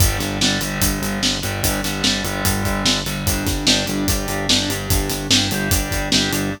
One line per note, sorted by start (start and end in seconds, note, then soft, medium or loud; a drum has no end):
0.00 0.17 G1 medium
0.00 0.18 D3 loud
0.00 0.18 G3 loud
0.00 kick loud
0.00 closed hi-hat loud
0.19 0.38 G1 medium
0.19 0.37 D3 medium
0.19 0.37 G3 medium
0.19 snare soft
0.19 closed hi-hat medium
0.41 0.58 G1 medium
0.41 0.60 D3 medium
0.41 0.61 G3 medium
0.41 snare loud
0.61 0.78 G1 medium
0.61 1.36 D3 medium
0.61 1.36 G3 medium
0.61 closed hi-hat medium
0.82 0.99 G1 medium
0.82 kick medium
0.82 closed hi-hat loud
1.02 1.19 G1 medium
1.02 closed hi-hat medium
1.22 1.40 G1 medium
1.22 snare medium
1.43 1.61 G1 medium
1.43 1.80 D3 medium
1.43 1.80 G3 medium
1.43 closed hi-hat medium
1.63 1.81 G1 medium
1.63 kick medium
1.63 closed hi-hat medium
1.84 2.01 G1 medium
1.84 2.03 D3 medium
1.84 2.03 G3 medium
1.84 snare medium
1.84 closed hi-hat medium
2.04 2.21 G1 medium
2.04 2.23 D3 medium
2.04 2.24 G3 medium
2.04 snare medium
2.24 2.42 G1 medium
2.24 2.99 D3 medium
2.24 2.99 G3 medium
2.24 closed hi-hat medium
2.45 2.62 G1 medium
2.45 kick medium
2.45 closed hi-hat medium
2.65 2.83 G1 medium
2.65 kick medium
2.65 closed hi-hat medium
2.85 3.03 G1 medium
2.85 snare loud
3.06 3.23 G1 medium
3.06 3.25 D3 medium
3.06 3.25 G3 medium
3.06 closed hi-hat medium
3.26 3.43 G1 loud
3.26 3.65 D4 loud
3.26 3.65 G4 loud
3.26 kick medium
3.26 closed hi-hat medium
3.47 3.64 G1 medium
3.47 kick medium
3.47 snare medium
3.47 closed hi-hat medium
3.67 3.84 G1 medium
3.67 3.86 D4 medium
3.67 3.86 G4 medium
3.67 snare loud
3.86 4.05 G1 medium
3.86 4.05 D4 loud
3.86 4.05 G4 medium
3.86 closed hi-hat medium
4.08 4.26 G1 medium
4.08 4.47 D4 medium
4.08 4.47 G4 medium
4.08 kick medium
4.08 closed hi-hat medium
4.28 4.46 G1 medium
4.28 closed hi-hat medium
4.49 4.66 G1 medium
4.49 4.69 D4 medium
4.49 4.69 G4 medium
4.49 snare loud
4.69 4.87 G1 medium
4.69 5.27 D4 medium
4.69 5.27 G4 medium
4.69 closed hi-hat medium
4.90 5.08 G1 medium
4.90 kick loud
4.90 closed hi-hat medium
5.09 5.27 G1 medium
5.09 snare soft
5.09 closed hi-hat medium
5.30 5.48 G1 medium
5.30 5.49 D4 medium
5.30 5.49 G4 medium
5.30 snare loud
5.51 5.69 G1 medium
5.51 5.70 D4 medium
5.51 5.71 G4 medium
5.51 closed hi-hat medium
5.71 5.89 G1 medium
5.71 6.09 D4 medium
5.71 6.09 G4 medium
5.71 kick medium
5.71 closed hi-hat medium
5.91 6.09 G1 medium
5.91 kick medium
5.91 closed hi-hat medium
6.12 6.29 G1 medium
6.12 6.31 D4 medium
6.12 6.31 G4 loud
6.12 snare loud
6.32 6.50 G1 medium
6.32 6.51 D4 medium
6.32 6.51 G4 medium
6.32 closed hi-hat medium